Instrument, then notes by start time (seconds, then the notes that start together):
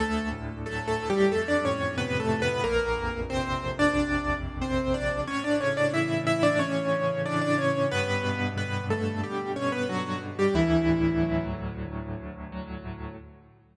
acoustic grand piano
0.00 D2 A3 A4
0.32 A2
0.66 F#3 A3 A4
0.88 A3 A4
0.99 A2
1.10 G3 G4
1.32 F2 A3 A4
1.48 D4 D5
1.64 A2 C#4 C#5
1.98 C3 B3 B4
2.20 A3 A4
2.30 A2
2.42 B3 B4
2.64 A#1 A#3 A#4
2.97 F2
3.29 C3 C4 C5
3.64 F2
3.79 D4 D5
3.95 A#1
4.30 F2
4.61 C3 C4 C5
4.94 F2 D4 D5
5.27 A2 C#4 C#5
5.44 D4 D5
5.60 C#3 C#4 C#5
5.77 D4 D5
5.94 E3 E4 E5
6.27 C#3 E4 E5
6.43 D4 D5
6.59 A2 C#4 C#5
6.92 C#3
7.26 E3 D4 D5
7.41 D4 D5
7.58 C#3 C#4 C#5
7.91 G2 B3 B4
8.24 B2
8.57 D3 B3 B4
8.90 B2 A3 A4
9.23 G2 G3 G4
9.56 B2 C#4 C#5
9.72 B3 B4
9.89 D3 F#3 F#4
10.21 B2
10.39 G3 G4
10.54 D2 E3 E4
10.88 A2
11.22 F#3
11.54 A2
11.87 D2
12.20 A2
12.52 F#3
12.85 A2